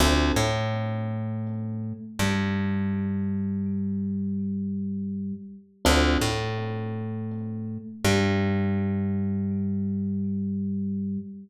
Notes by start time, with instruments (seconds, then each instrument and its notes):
0.00 electric bass (finger) D2, electric piano 1 C4 D4 F4 A4
0.36 electric bass (finger) A2, electric piano 1 A3
2.19 electric bass (finger) G2, electric piano 1 G3
5.85 electric bass (finger) D2, electric piano 1 C4 D4 F4 A4
6.21 electric bass (finger) A2, electric piano 1 A3
8.05 electric bass (finger) G2, electric piano 1 G3